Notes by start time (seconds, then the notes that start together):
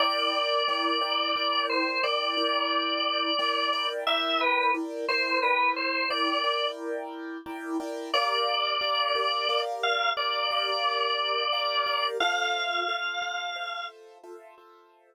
0.00 E4 A#4 D5 G5
0.68 E4 A#4 D5 G5
1.01 E4 A#4 D5 G5
1.36 E4 A#4 D5 G5
1.69 C5
2.03 E4 A#4 D5 G5
2.37 E4 A#4 D5 G5
3.39 E4 A#4 D5 G5
3.73 E4 A#4 D5 G5
4.07 E4 A#4 D5 E5 G5
4.41 B4
4.74 E4 A#4 D5 G5
5.08 E4 A#4 C5 D5 G5
5.42 E4 A#4 B4 D5 G5
5.76 C5
6.10 E4 A#4 D5 G5
6.44 E4 A#4 D5 G5
7.46 E4 A#4 D5 G5
7.80 E4 A#4 D5 G5
8.14 G4 A#4 D5 F5
8.81 G4 A#4 D5 F5
9.15 G4 A#4 D5 F5
9.49 G4 A#4 D5 F5
9.83 F5
10.17 G4 A#4 D5 F5
10.51 G4 A#4 D5 F5
11.53 G4 A#4 D5 F5
11.86 G4 A#4 D5 F5
12.20 F4 A4 C5 E5 F5
12.88 F4 A4 C5 E5
13.22 F4 A4 C5 E5
13.56 F4 A4 C5 E5
14.23 F4 A4 C5 E5
14.58 F4 A4 C5 E5